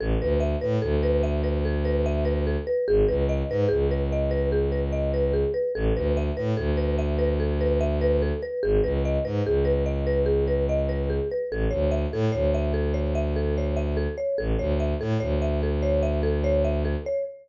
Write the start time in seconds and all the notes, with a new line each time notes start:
0.00 A1 A4
0.21 D2 B4
0.40 E5
0.61 A2 B4
0.82 D2 A4
1.03 B4
1.23 E5
1.44 B4
1.65 A4
1.85 B4
2.06 E5
2.25 B4
2.47 A4
2.67 B4
2.88 G#1 G#4
3.08 C#2 B4
3.29 D#5
3.49 G#2 B4
3.69 C#2 G#4
3.91 B4
4.12 D#5
4.31 B4
4.52 G#4
4.72 B4
4.92 D#5
5.14 B4
5.33 G#4
5.54 B4
5.75 A1 A4
5.96 D2 B4
6.17 E5
6.37 A2 B4
6.57 D2 A4
6.77 B4
6.99 E5
7.19 B4
7.40 A4
7.61 B4
7.81 E5
8.01 B4
8.22 A4
8.43 B4
8.63 G#1 G#4
8.83 C#2 B4
9.05 D#5
9.25 G#2 B4
9.45 C#2 G#4
9.65 B4
9.86 D#5
10.07 B4
10.26 G#4
10.48 B4
10.69 D#5
10.89 B4
11.10 G#4
11.32 B4
11.51 A1 A4
11.71 D2 C#5
11.91 E5
12.12 A2 A4
12.32 D2 C#5
12.54 E5
12.74 A4
12.94 C#5
13.15 E5
13.36 A4
13.58 C#5
13.77 E5
13.97 A4
14.18 C#5
14.38 A1 A4
14.59 D2 C#5
14.80 E5
15.00 A2 A4
15.20 D2 C#5
15.42 E5
15.63 A4
15.83 C#5
16.03 E5
16.23 A4
16.44 C#5
16.65 E5
16.85 A4
17.06 C#5